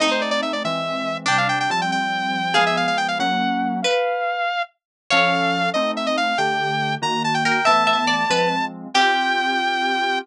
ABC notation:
X:1
M:6/8
L:1/16
Q:3/8=94
K:Gmix
V:1 name="Lead 2 (sawtooth)"
_e c d d =e d e6 | g f g g a g g6 | f e f f g f ^f6 | f8 z4 |
f6 _e2 _f e =f2 | g6 _b2 a g g2 | a10 z2 | g12 |]
V:2 name="Pizzicato Strings"
_E12 | D4 z8 | _A12 | _c6 z6 |
^c12 | z10 _B2 | e2 e z d2 B2 z4 | G12 |]
V:3 name="Electric Piano 2"
[A,C_E]6 [=E,^G,^B,]6 | [C,G,D]4 [F,G,C]8 | [F,_A,_C]6 [^F,^A,^C]6 | z12 |
[F,^CA]6 [A,=C_E]6 | [D,A,G]6 [_E,_B,_G]6 | [E,A,B,]6 [F,_A,C]6 | [CFG]12 |]